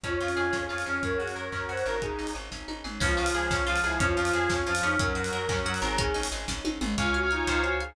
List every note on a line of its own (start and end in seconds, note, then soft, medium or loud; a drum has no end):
0.04 0.18 F2 medium
0.04 0.53 C#4 medium
0.04 1.02 C#4 medium
0.04 0.19 C#4 medium
0.04 0.76 F4 medium
0.04 1.02 F4 medium
0.04 1.02 G#4 medium
0.04 0.64 C#5 medium
0.04 kick loud
0.04 closed hi-hat loud
0.20 0.34 F2 medium
0.20 0.35 F4 medium
0.20 0.69 F4 medium
0.28 open hi-hat medium
0.35 0.51 F2 medium
0.35 0.98 G#4 medium
0.35 0.52 G#4 medium
0.53 0.67 F2 medium
0.53 0.67 C#4 medium
0.53 0.85 C#4 medium
0.53 kick medium
0.53 snare loud
0.69 0.84 F2 medium
0.69 0.84 F4 medium
0.69 1.01 F4 medium
0.69 1.00 C#5 medium
0.78 open hi-hat medium
0.86 1.00 F2 medium
0.86 1.52 C#4 medium
0.86 1.03 C#4 medium
0.86 1.01 G#4 medium
1.03 1.17 F#2 medium
1.03 1.18 C#4 medium
1.03 2.01 C#4 medium
1.03 2.01 F#4 medium
1.03 1.18 A#4 medium
1.03 2.01 A#4 medium
1.03 1.62 C#5 medium
1.03 kick loud
1.03 closed hi-hat medium
1.18 1.34 F#2 medium
1.18 1.68 F#4 medium
1.18 1.33 F#4 medium
1.18 1.33 G#4 medium
1.27 open hi-hat medium
1.35 1.50 F#2 medium
1.35 1.86 A#4 medium
1.35 1.51 A#4 medium
1.52 1.66 F#2 medium
1.52 1.99 C#4 medium
1.52 1.67 C#4 medium
1.52 1.68 A#4 medium
1.52 kick medium
1.52 clap loud
1.68 1.83 F#2 medium
1.68 2.00 F#4 medium
1.68 1.84 F#4 medium
1.68 1.83 C5 medium
1.68 1.98 C#5 medium
1.77 open hi-hat medium
1.86 2.16 G#1 medium
1.86 1.99 A#4 medium
1.86 2.00 A#4 medium
1.86 2.02 A#4 medium
2.02 2.17 C#4 medium
2.02 3.01 C#4 medium
2.02 2.34 D#4 medium
2.02 3.01 D#4 medium
2.02 2.30 G#4 medium
2.02 3.01 G#4 medium
2.02 kick loud
2.02 closed hi-hat loud
2.19 2.33 G#1 medium
2.19 2.33 D#4 medium
2.27 open hi-hat medium
2.35 2.49 G#1 medium
2.35 2.50 G#4 medium
2.52 2.66 G#1 medium
2.52 2.67 C#4 medium
2.52 kick medium
2.52 snare loud
2.68 2.82 G#1 medium
2.68 2.83 D#4 medium
2.68 high tom medium
2.84 2.99 G#1 medium
2.84 2.99 G#4 medium
2.84 mid tom medium
3.00 3.15 C#2 loud
3.00 3.61 F3 medium
3.00 3.15 C#4 loud
3.00 3.18 C#4 loud
3.00 3.99 C#4 loud
3.00 3.99 F4 loud
3.00 3.76 F4 medium
3.00 3.99 G#4 loud
3.00 kick loud
3.00 crash loud
3.17 3.32 C#2 medium
3.17 3.32 F4 medium
3.17 3.36 F4 medium
3.26 open hi-hat loud
3.34 3.48 C#2 medium
3.34 3.50 G#4 medium
3.50 3.65 C#2 medium
3.50 3.67 C#4 medium
3.50 3.66 C#4 medium
3.50 kick loud
3.50 snare loud
3.66 3.81 C#2 medium
3.66 3.97 F3 medium
3.66 3.83 F4 loud
3.66 3.81 F4 loud
3.76 open hi-hat loud
3.84 3.98 C#2 medium
3.84 4.00 E4 medium
3.84 3.99 G#4 medium
3.84 4.00 G#4 medium
3.99 4.14 F2 loud
3.99 4.55 F3 medium
3.99 4.15 C#4 loud
3.99 4.99 C#4 loud
3.99 4.16 C#4 loud
3.99 4.99 F4 loud
3.99 4.70 F4 medium
3.99 4.99 G#4 medium
3.99 kick loud
3.99 closed hi-hat loud
4.16 4.31 F2 loud
4.16 4.33 F4 medium
4.16 4.32 F4 medium
4.25 open hi-hat loud
4.33 4.47 F2 medium
4.33 4.48 G#4 medium
4.33 4.51 G#4 loud
4.49 4.64 F2 medium
4.49 4.64 C#4 medium
4.49 4.67 C#4 medium
4.49 kick loud
4.49 snare loud
4.66 4.80 F2 medium
4.66 4.95 F3 medium
4.66 4.82 F4 medium
4.66 4.83 F4 medium
4.75 open hi-hat loud
4.83 4.97 F2 medium
4.83 5.16 C#4 loud
4.83 4.97 D#4 medium
4.83 4.98 G#4 medium
4.99 5.13 F#2 loud
4.99 5.58 F#3 medium
4.99 5.97 C#4 loud
4.99 5.15 C#4 loud
4.99 5.97 F#4 loud
4.99 5.97 A#4 loud
4.99 5.80 A#4 medium
4.99 kick loud
4.99 closed hi-hat loud
5.15 5.30 F#2 medium
5.15 5.30 F#4 medium
5.15 5.32 F#4 medium
5.24 open hi-hat loud
5.32 5.46 F#2 medium
5.32 5.48 A#4 medium
5.32 5.49 A#4 medium
5.48 5.63 F#2 medium
5.48 5.65 C#4 medium
5.48 5.64 C#4 medium
5.48 kick loud
5.48 clap loud
5.65 5.80 F#2 medium
5.65 5.97 F#3 medium
5.65 5.82 F#4 medium
5.65 5.81 F#4 medium
5.74 open hi-hat loud
5.82 6.13 G#1 loud
5.82 5.98 G#4 medium
5.82 5.97 A#4 medium
5.82 5.98 A#4 loud
5.98 6.13 C#4 loud
5.98 6.28 C#4 loud
5.98 6.97 C#4 loud
5.98 6.97 D#4 loud
5.98 6.27 G#4 medium
5.98 6.97 G#4 loud
5.98 kick loud
5.98 closed hi-hat loud
6.14 6.29 G#1 medium
6.14 6.29 D#4 medium
6.23 open hi-hat loud
6.32 6.46 G#1 medium
6.32 6.47 G#4 medium
6.48 6.62 G#1 medium
6.48 6.64 C#4 medium
6.48 kick loud
6.48 snare loud
6.65 6.79 G#1 medium
6.65 6.80 D#4 medium
6.65 high tom loud
6.81 6.95 G#1 loud
6.81 6.96 G#4 medium
6.81 mid tom loud
6.98 7.44 C#2 loud
6.98 7.25 C#4 loud
6.98 7.13 F4 medium
6.98 7.17 C#5 medium
6.98 7.45 C#5 loud
6.98 7.17 F5 medium
6.98 7.17 G#5 medium
6.98 kick loud
6.98 closed hi-hat loud
7.14 7.29 F#4 medium
7.14 7.46 F5 medium
7.14 closed hi-hat medium
7.23 7.30 C#5 medium
7.23 7.30 F5 medium
7.23 7.30 G#5 medium
7.31 7.62 D#4 loud
7.31 7.44 F4 medium
7.31 7.46 C#5 medium
7.31 7.46 F5 medium
7.31 7.48 G#5 medium
7.31 7.46 G#5 medium
7.31 closed hi-hat medium
7.47 7.93 C#2 loud
7.47 7.61 F4 medium
7.47 7.95 C5 medium
7.47 7.74 C5 medium
7.47 7.74 C#5 medium
7.47 7.74 F5 medium
7.47 7.74 G#5 medium
7.47 kick loud
7.47 closed hi-hat loud
7.64 7.77 F#4 medium
7.64 7.95 C#5 medium
7.64 closed hi-hat medium
7.80 7.95 G#4 medium
7.80 7.95 F5 medium
7.80 closed hi-hat medium